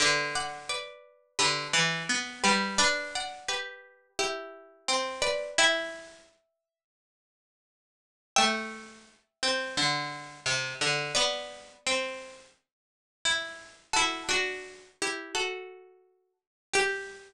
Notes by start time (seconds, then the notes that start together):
0.00 D3 B4 D5
0.35 D5 F#5
0.69 B4 D5
1.39 D3 G4 B4
1.73 E3
2.09 B3
2.44 G3 G4 B4
2.78 D4 B4 D5
3.15 D5 F#5
3.48 G4 B4
4.19 E4 G4
4.88 C4
5.22 B4 D5
5.58 E4 E5 G5
8.36 A3 E5 G5
9.43 C4
9.77 D3
10.46 C3
10.81 D3
11.15 B3 B4 D5
11.86 C4
13.25 E4
13.93 E4 F#4 A4
14.29 D4 F#4
15.02 E4 G4
15.35 F#4 A4
16.73 G4